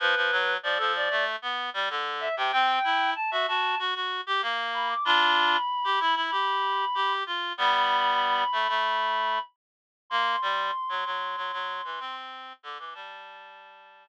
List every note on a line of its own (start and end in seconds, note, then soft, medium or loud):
0.00 0.15 F3 medium
0.00 0.54 B4 medium
0.16 0.31 F3 medium
0.31 0.57 F#3 medium
0.63 0.78 F3 medium
0.63 0.78 D5 medium
0.78 1.09 F3 medium
0.78 0.93 A4 medium
0.96 1.24 D5 medium
1.11 1.36 A3 medium
1.42 1.70 B3 medium
1.74 1.89 G3 medium
1.90 2.28 D3 medium
2.20 2.35 E5 medium
2.37 2.52 C3 medium
2.37 2.51 G5 medium
2.51 2.79 C4 medium
2.51 3.11 G5 medium
2.84 3.14 E4 medium
3.16 3.31 A5 medium
3.31 3.46 F#4 medium
3.31 3.46 E5 medium
3.48 3.75 F#4 medium
3.48 3.78 A5 medium
3.79 3.94 F#4 medium
3.95 4.21 F#4 medium
4.27 4.42 G4 medium
4.42 4.94 A#3 medium
4.74 4.89 B5 medium
4.89 5.04 D6 medium
5.05 5.57 D4 medium
5.05 5.57 F4 loud
5.05 7.13 B5 medium
5.84 5.99 G4 medium
6.00 6.15 E4 medium
6.16 6.31 E4 medium
6.31 6.85 G4 medium
6.95 7.24 G4 medium
7.26 7.53 F4 medium
7.58 8.44 G3 medium
7.58 8.44 B3 medium
7.58 9.40 B5 medium
8.52 8.67 A3 medium
8.69 9.39 A3 medium
10.10 10.36 A#3 medium
10.10 12.15 C6 medium
10.42 10.71 G3 medium
10.89 11.04 F#3 medium
11.06 11.36 F#3 medium
11.37 11.52 F#3 medium
11.53 11.81 F#3 medium
11.84 11.99 E3 medium
12.00 12.53 C4 medium
12.63 12.78 D3 medium
12.63 12.77 D6 medium
12.78 12.94 E3 medium
12.78 12.93 D6 medium
12.94 14.06 G3 medium
12.94 14.08 A5 medium